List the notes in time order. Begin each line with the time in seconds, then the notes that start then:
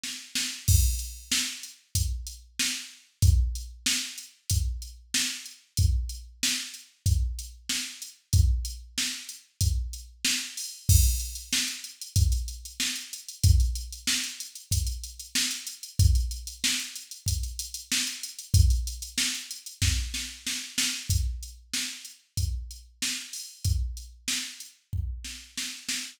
0.04 snare
0.35 snare
0.68 kick, crash
0.99 closed hi-hat
1.32 snare
1.63 closed hi-hat
1.95 kick, closed hi-hat
2.27 closed hi-hat
2.59 snare
3.22 kick, closed hi-hat
3.55 closed hi-hat
3.86 snare
4.18 closed hi-hat
4.50 kick, closed hi-hat
4.82 closed hi-hat
5.14 snare
5.46 closed hi-hat
5.77 kick, closed hi-hat
6.09 closed hi-hat
6.43 snare
6.74 closed hi-hat
7.06 kick, closed hi-hat
7.39 closed hi-hat
7.69 snare
8.02 closed hi-hat
8.33 kick, closed hi-hat
8.65 closed hi-hat
8.98 snare
9.29 closed hi-hat
9.61 kick, closed hi-hat
9.93 closed hi-hat
10.25 snare
10.57 open hi-hat
10.89 kick, crash
11.04 closed hi-hat
11.20 closed hi-hat
11.35 closed hi-hat
11.53 snare
11.68 closed hi-hat
11.84 closed hi-hat
12.01 closed hi-hat
12.16 kick, closed hi-hat
12.32 closed hi-hat
12.48 closed hi-hat
12.65 closed hi-hat
12.80 snare
12.96 closed hi-hat
13.13 closed hi-hat
13.29 closed hi-hat
13.44 kick, closed hi-hat
13.60 closed hi-hat
13.76 closed hi-hat
13.93 closed hi-hat
14.07 snare
14.24 closed hi-hat
14.40 closed hi-hat
14.55 closed hi-hat
14.71 kick, closed hi-hat
14.87 closed hi-hat
15.04 closed hi-hat
15.20 closed hi-hat
15.35 snare
15.51 closed hi-hat
15.67 closed hi-hat
15.83 closed hi-hat
15.99 kick, closed hi-hat
16.15 closed hi-hat
16.31 closed hi-hat
16.47 closed hi-hat
16.64 snare
16.80 closed hi-hat
16.96 closed hi-hat
17.11 closed hi-hat
17.26 kick, closed hi-hat
17.43 closed hi-hat
17.59 closed hi-hat
17.74 closed hi-hat
17.92 snare
18.07 closed hi-hat
18.23 closed hi-hat
18.39 closed hi-hat
18.54 kick, closed hi-hat
18.70 closed hi-hat
18.87 closed hi-hat
19.02 closed hi-hat
19.18 snare
19.35 closed hi-hat
19.51 closed hi-hat
19.66 closed hi-hat
19.82 kick, snare
20.14 snare
20.47 snare
20.78 snare
21.10 kick, closed hi-hat
21.43 closed hi-hat
21.74 snare
22.05 closed hi-hat
22.37 kick, closed hi-hat
22.71 closed hi-hat
23.02 snare
23.33 open hi-hat
23.65 kick, closed hi-hat
23.97 closed hi-hat
24.28 snare
24.60 closed hi-hat
24.93 kick
25.25 snare
25.57 snare
25.89 snare